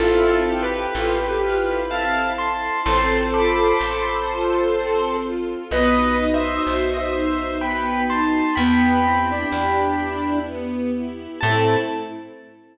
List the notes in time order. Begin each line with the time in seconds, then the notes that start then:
0.00 A1 C4 E4 F4 A4
0.47 E4 G4
0.63 G4 B4
0.95 A1 F4 A4
1.18 G4
1.28 G4 B4
1.42 E4 F4
1.90 C4 E4 F5 A5
2.38 E4 A5 C6
2.86 A1 C4 F4 A4 C5 A5 C6
3.34 F4 B5 D6
3.81 A1 A4
4.29 F4
4.75 C4
5.24 F4
5.71 B1 B3 D#4 F#4 B4 D#5
6.18 D#4 D#5
6.34 C5 E5
6.67 B1 F#4 C5
6.91 D#5
6.97 C5 E5
7.14 D#4 C5
7.61 B3 B4 G5 B5
8.10 D#4 A5 C6
8.55 E2 B3 E4 G4 G5 B5
9.05 C4 E4
9.30 D4
9.52 E2 G4
10.00 E4
10.47 B3
10.95 E4
11.41 A2 A3 C4 E4 A4 A5